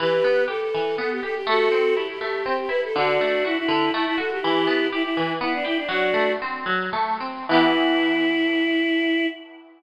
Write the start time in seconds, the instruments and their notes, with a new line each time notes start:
0.00 acoustic guitar (steel) E3, choir aahs G4 B4
0.24 acoustic guitar (steel) B3
0.48 acoustic guitar (steel) G4, choir aahs A4
0.61 choir aahs A4
0.74 acoustic guitar (steel) E3
0.98 acoustic guitar (steel) B3, choir aahs A4
1.11 choir aahs G4
1.23 acoustic guitar (steel) G4, choir aahs A4
1.35 choir aahs G4
1.47 acoustic guitar (steel) A3, choir aahs F#4 A4
1.72 acoustic guitar (steel) C4
1.95 acoustic guitar (steel) E4, choir aahs G4
2.10 choir aahs G4
2.21 acoustic guitar (steel) A3
2.45 acoustic guitar (steel) C4, choir aahs G4
2.59 choir aahs G4
2.69 acoustic guitar (steel) E4, choir aahs B4
2.84 choir aahs A4
2.96 acoustic guitar (steel) D3, choir aahs D4 F#4
3.21 acoustic guitar (steel) A3
3.44 choir aahs E4, acoustic guitar (steel) F#4
3.57 choir aahs E4
3.68 acoustic guitar (steel) D3
3.93 acoustic guitar (steel) A3, choir aahs E4
4.06 choir aahs E4
4.18 acoustic guitar (steel) F#4, choir aahs A4
4.32 choir aahs G4
4.41 acoustic guitar (steel) E3, choir aahs E4 G4
4.67 acoustic guitar (steel) B3
4.92 choir aahs E4, acoustic guitar (steel) G4
5.03 choir aahs E4
5.17 acoustic guitar (steel) E3
5.41 acoustic guitar (steel) B3, choir aahs E4
5.54 choir aahs D4
5.65 choir aahs E4, acoustic guitar (steel) G4
5.77 choir aahs D4
5.89 acoustic guitar (steel) F#3, choir aahs D4 F#4
6.14 acoustic guitar (steel) A3
6.42 acoustic guitar (steel) C4
6.66 acoustic guitar (steel) F#3
6.93 acoustic guitar (steel) A3
7.20 acoustic guitar (steel) C4
7.49 acoustic guitar (steel) E3 B3, choir aahs E4
7.53 acoustic guitar (steel) G4